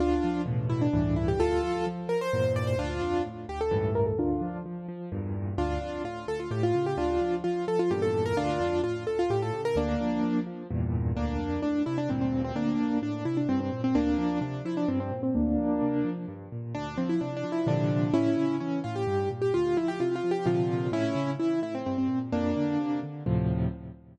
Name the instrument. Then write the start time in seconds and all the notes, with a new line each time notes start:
acoustic grand piano
0.00 D2 D4 F4
0.24 F3
0.46 E2 A2 B2
0.69 E4
0.81 D4
0.93 C#2 G2 A2 E3
1.16 E4
1.28 G4
1.39 D2 F4 A4
1.63 F3
1.87 F3
2.09 F3 A#4
2.21 C5
2.33 E2 G2 A#2
2.56 D5
2.67 C5
2.78 D2 D4 F4
3.02 F2
3.25 A2
3.49 D2 G4
3.61 A4
3.71 C#2 G2 A2 E3
3.95 A#4
4.06 A4
4.18 D2 D4 F4
4.41 F3
4.66 F3
4.88 F3
5.12 E2 G2 A#2
5.58 D2 D4 F4
5.82 F2
6.04 A2 F4
6.27 D2 A4
6.40 F4
6.51 A2 G4
6.63 F4
6.75 C#3
6.86 G4
6.97 D2 D4 F4
7.21 F3
7.44 F3 F4
7.68 F3 A4
7.79 F4
7.91 E2 G2 A#2 G4
8.02 A4
8.26 A#4
8.37 D2 D4 F4
8.60 F2
8.84 A2 F4
9.07 D2 A4
9.19 F4
9.30 A2 G4
9.42 A4
9.53 C#3
9.65 A#4
9.76 D2 A#3 D4
10.01 F3
10.23 F3
10.46 F3
10.71 E2 G2 A#2
11.16 D2 A#3 D4
11.39 F2
11.62 A2 D4
11.86 C3 E4
11.98 D4
12.09 D2 G2 A#2 C4
12.21 C4
12.44 C4
12.55 D2 A#3 D4
12.79 F2
13.02 A2 D4
13.25 C3 E4
13.37 D4
13.49 G2 C4
13.60 C4
13.73 A#2
13.84 C4
13.95 D2 A#3 D4
14.18 F3
14.41 C3 D4
14.65 F3 E4
14.77 D4
14.88 G2 C4
15.00 C4
15.11 A#2
15.23 C4
15.35 D2 A#3 D4
15.58 F3
15.82 C3
16.04 F3
16.28 G2
16.52 A#2
16.75 D2 D4
16.97 F3 C4
17.09 E4
17.21 C3 D4
17.37 D4
17.44 F3
17.52 E4
17.66 A#2 C3 D3 F3 D4
18.14 A2 C#4 E4
18.37 C#3
18.60 E3 C#4
18.84 A2 F4
18.96 G4
19.07 G2
19.31 A#2
19.42 G4
19.54 D2 F4
19.77 F3 E4
19.88 G4
20.00 C3 F4
20.16 F4
20.24 F3
20.31 G4
20.46 A#2 C3 D3 F3 F4
20.92 A2 C#4 E4
21.15 C#3
21.39 E3 E4
21.62 A2 E4
21.75 C4
21.86 G2 C4
21.98 C4
22.08 A#2
22.32 F2 A#3 D4
22.57 D3
22.80 C3
23.03 D3
23.26 D2 A2 C3 F3